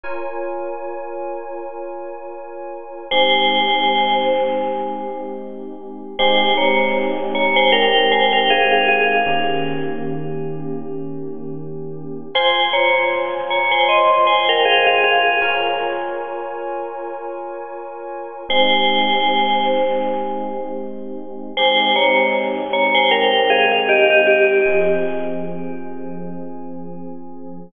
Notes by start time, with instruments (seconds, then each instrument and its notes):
0.04 electric piano 2 F4 A#4 C#5 G#5
3.11 electric piano 2 G#3 C4 D#4 G4, tubular bells C5 G#5
6.19 electric piano 2 G#3 C4 D#4 G4, tubular bells C5 G#5
6.57 tubular bells C#5 A#5
7.35 tubular bells C#5 A#5
7.56 tubular bells C5 G#5
7.72 tubular bells A#4 G5
8.12 tubular bells C5 G#5
8.33 tubular bells A#4 G5
8.50 tubular bells G#4 F5
8.72 tubular bells G#4 F5
8.88 tubular bells G#4 F5
9.26 electric piano 2 D#3 A#3 C#4 G4
12.35 electric piano 2 F4 C5 G#5, tubular bells C5 G#5
12.73 tubular bells C#5 A#5
13.50 tubular bells C#5 A#5
13.71 tubular bells C5 G#5
13.89 tubular bells D#5 C6
14.27 tubular bells C5 G#5
14.49 tubular bells A#4 G5
14.65 tubular bells G#4 F5
14.87 tubular bells G#4 F5
15.04 tubular bells G#4 F5
15.41 electric piano 2 F4 A#4 C#5 G#5
18.49 electric piano 2 G#3 C4 D#4 G4, tubular bells C5 G#5
21.57 electric piano 2 G#3 C4 D#4 G4, tubular bells C5 G#5
21.96 tubular bells C#5 A#5
22.73 tubular bells C#5 A#5
22.95 tubular bells C5 G#5
23.11 tubular bells A#4 G5
23.50 tubular bells G#4 F5
23.72 tubular bells G#4 F5
23.89 tubular bells G4 D#5
24.10 tubular bells G4 D#5
24.27 tubular bells G4 D#5
24.66 electric piano 2 F3 C4 G#4